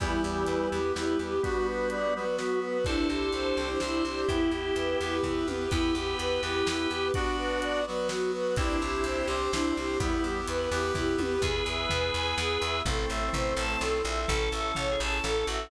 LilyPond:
<<
  \new Staff \with { instrumentName = "Choir Aahs" } { \time 3/4 \key e \minor \tempo 4 = 126 e'8 g'8 b'8 g'8 e'8 g'8 | fis'8 b'8 d''8 b'8 fis'8 b'8 | e'8 g'8 c''8 g'8 e'8 g'8 | e'8 g'8 b'8 g'8 e'8 g'8 |
e'8 g'8 b'8 g'8 e'8 g'8 | fis'8 b'8 d''8 b'8 fis'8 b'8 | e'8 g'8 c''8 g'8 e'8 g'8 | e'8 g'8 b'8 g'8 e'8 g'8 |
\key e \major gis'8 e''8 b'8 gis''8 gis'8 e''8 | a'8 e''8 c''8 a''8 a'8 e''8 | a'8 e''8 cis''8 a''8 a'8 e''8 | }
  \new Staff \with { instrumentName = "Drawbar Organ" } { \time 3/4 \key e \minor <e g>2 g4 | <g b>2 b4 | <a' c''>2 c''4 | <e' g'>2 r4 |
<g' b'>2. | <d' fis'>4. r4. | <c' e'>2 c'4 | <g b>4 r2 |
\key e \major <gis' b'>2. | <a c'>2. | \tuplet 3/2 { a'4 a'4 gis'4 } a'8 fis'8 | }
  \new Staff \with { instrumentName = "String Ensemble 1" } { \time 3/4 \key e \minor e'8 g'8 b'8 e'8 g'8 b'8 | r2. | d'8 e'8 g'8 c''8 d'8 e'8 | e'8 g'8 b'8 e'8 g'8 b'8 |
e'8 g'8 b'8 e'8 g'8 b'8 | r2. | d'8 e'8 g'8 c''8 d'8 e'8 | e'8 g'8 b'8 e'8 g'8 b'8 |
\key e \major r2. | r2. | r2. | }
  \new Staff \with { instrumentName = "Electric Bass (finger)" } { \clef bass \time 3/4 \key e \minor e,8 e,8 e,8 e,8 e,8 e,8 | r2. | c,8 c,8 c,8 c,8 c,8 c,8 | e,8 e,8 e,8 e,8 e,8 e,8 |
e,8 e,8 e,8 e,8 e,8 e,8 | r2. | c,8 c,8 c,8 c,8 c,8 c,8 | e,8 e,8 e,8 e,8 e,8 e,8 |
\key e \major e,8 e,8 e,8 e,8 e,8 e,8 | a,,8 a,,8 a,,8 a,,8 b,,8 ais,,8 | a,,8 a,,8 a,,8 a,,8 a,,8 a,,8 | }
  \new Staff \with { instrumentName = "Brass Section" } { \time 3/4 \key e \minor <b e' g'>4. <b g' b'>4. | <b d' fis'>4. <fis b fis'>4. | <c' d' e' g'>4. <c' d' g' c''>4. | <b e' g'>4. <b g' b'>4. |
<b e' g'>4. <b g' b'>4. | <b d' fis'>4. <fis b fis'>4. | <c' d' e' g'>4. <c' d' g' c''>4. | <b e' g'>4. <b g' b'>4. |
\key e \major <b e' gis'>2. | <c' e' a'>2. | <cis' e' a'>2. | }
  \new DrumStaff \with { instrumentName = "Drums" } \drummode { \time 3/4 <hh bd>4 hh4 sn4 | <hh bd>4 hh4 sn4 | <hh bd>4 hh4 sn4 | <hh bd>4 hh4 <bd tomfh>8 tommh8 |
<hh bd>4 hh4 sn4 | <hh bd>4 hh4 sn4 | <hh bd>4 hh4 sn4 | <hh bd>4 hh4 <bd tomfh>8 tommh8 |
<bd tomfh>4 tomfh4 sn4 | <bd tomfh>4 tomfh4 sn4 | <bd tomfh>4 tomfh4 sn4 | }
>>